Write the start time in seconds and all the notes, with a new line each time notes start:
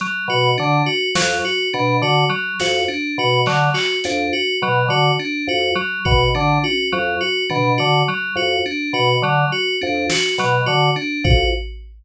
0.00 F#3, closed hi-hat
0.28 B2 F#4
0.58 D3 D4
0.86 F#4
1.15 F2 F#3, snare
1.45 F#4
1.73 B2 D4
2.02 D3 F#4
2.29 F#3
2.60 F2 F#4, snare
2.88 D4
3.18 B2 F#4
3.46 D3 F#3, clap
3.74 F#4, clap
4.04 F2 D4, closed hi-hat
4.33 F#4
4.62 B2 F#3
4.88 D3 F#4
5.19 D4
5.47 F2 F#4
5.75 F#3
6.05 B2 F#4, kick
6.35 D3 D4
6.63 F#4, high tom
6.92 F2 F#3
7.21 F#4
7.50 B2 D4, floor tom
7.78 D3 F#4
8.08 F#3
8.35 F2 F#4
8.66 D4
8.93 B2 F#4
9.22 D3 F#3
9.52 F#4
9.81 F2 D4
10.10 F#4, snare
10.38 B2 F#3, closed hi-hat
10.66 D3 F#4
10.96 D4
11.24 F2 F#4, kick